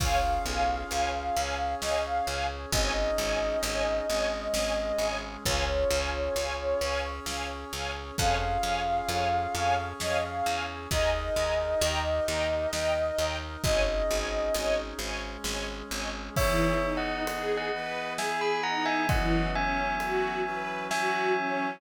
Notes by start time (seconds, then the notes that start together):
0.00 C#2 C#4 F4 G#4 C#5 F5 G#5, kick, crash
0.45 B1 C#5 F5 G#5
0.90 C#2 C#5 F5 G#5, closed hi-hat
1.36 C#2 C#4 G#4 C#5 F5 G#5
1.80 C#2 C#5 D#5 F5 G#5, snare
2.05 F5
2.26 C#2 C#5 F5 G#5
2.71 G#1 C#4 D#4 G#4 C#5 D#5 G#5, kick, closed hi-hat
3.18 G#1 C#5 D#5 G#5
3.63 G#1 C#5 D#5 G#5, closed hi-hat
4.08 G#1 G#3 C#4 G#4 C#5 D#5 G#5
4.54 G#1 C#5 D#5 G#5, snare
4.98 G#1 C#5 D#5 G#5
5.45 C#2 C#4 F4 G#4 C#5 F5 G#5, kick, closed hi-hat
5.91 C#2 C#5 F5 G#5
6.35 C#2 C#5 F5 G#5, closed hi-hat
6.81 C#2 C#4 G#4 C#5 F5 G#5
7.26 C#2 C#5 F5 G#5, snare
7.73 C#2 C#5 F5 G#5
8.18 F2 C#4 F4 G#4 C#5 F5 G#5, kick, closed hi-hat
8.62 F2 C#5 F5 G#5
9.09 F2 C#5 F5 G#5, closed hi-hat
9.54 F2 C#4 G#4 C#5 F5 G#5
9.99 F2 C#5 D#5 F5 G#5, snare
10.22 F5
10.44 E2 C#5 F5 G#5
10.91 D#2 D#4 G#4 A#4 D#5 G#5 A#5, kick, closed hi-hat
11.34 D#2 D#5 G#5 A#5
11.80 D#2 D#4 G4 A#4 D#5 G5 A#5, closed hi-hat
12.26 D#2 D#5 G5 A#5
12.72 D#2 D#4 A#4 D#5 G5 A#5, snare
13.18 D#2 D#5 G5 A#5
13.63 G#1 C#4 D#4 G#4 C#5 D#5 G#5, kick, closed hi-hat
14.10 G#1 C#5 D#5 G#5
14.55 G#1 C#5 D#5 G#5, closed hi-hat
14.99 G#1 G#3 C#4 G#4 C#5 D#5 G#5
15.44 G#1 C#5 D#5 G#5, snare
15.91 G#1 C#5 D#5 G#5
16.35 E3 B3 D#4 G#4 C#5 E5, kick, crash
16.82 D#4
16.97 D#5 F#5
17.27 G#4, ride
17.57 D#5 F#5
17.72 E3 B3 E4 G#4 B4
18.18 G#4 E5 G#5, snare
18.41 G#5 B5
18.63 D#4 F#5 A#5
18.85 E5 G#5
19.09 E3 F#3 B3 C#4 D#5 F#5, kick, ride
19.54 C#4 E5 G#5
20.00 F#4, ride
20.44 E3 F#3 C#4 F#4 B4
20.91 F#4 E5 G#5, snare
21.37 C#4